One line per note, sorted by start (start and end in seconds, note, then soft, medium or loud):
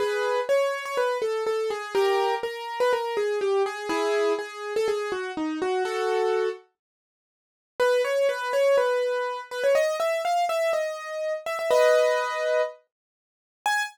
0.00 0.40 G#4 medium
0.00 0.40 B4 medium
0.49 0.84 C#5 medium
0.85 0.97 C#5 medium
0.97 1.18 B4 medium
1.22 1.44 A4 medium
1.47 1.70 A4 medium
1.70 1.94 G#4 medium
1.95 2.35 G4 medium
1.95 2.35 A#4 medium
2.43 2.79 A#4 medium
2.80 2.92 B4 medium
2.93 3.17 A#4 medium
3.17 3.39 G#4 medium
3.41 3.63 G4 medium
3.66 3.89 G#4 medium
3.89 4.33 E4 medium
3.89 4.33 G#4 medium
4.39 4.73 G#4 medium
4.76 4.88 A4 medium
4.88 5.11 G#4 medium
5.12 5.32 F#4 medium
5.37 5.59 D#4 medium
5.62 5.83 F#4 medium
5.85 6.49 F#4 medium
5.85 6.49 A4 medium
7.80 8.02 B4 medium
8.05 8.27 C#5 medium
8.29 8.52 B4 medium
8.53 8.76 C#5 medium
8.78 9.40 B4 medium
9.51 9.63 B4 medium
9.64 9.75 C#5 medium
9.75 9.96 D#5 medium
10.00 10.22 E5 medium
10.25 10.45 F5 medium
10.49 10.72 E5 medium
10.73 11.33 D#5 medium
11.46 11.58 E5 medium
11.59 11.71 E5 medium
11.71 12.61 B4 medium
11.71 12.61 D#5 medium
13.66 13.83 G#5 loud